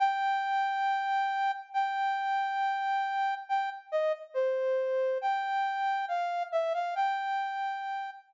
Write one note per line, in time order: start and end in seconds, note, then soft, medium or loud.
0.00 1.51 G5 loud
1.74 3.34 G5 medium
3.49 3.70 G5 medium
3.92 4.12 D#5 medium
4.34 5.18 C5 medium
5.21 6.05 G5 medium
6.08 6.43 F5 medium
6.52 6.73 E5 medium
6.74 6.94 F5 medium
6.95 8.10 G5 loud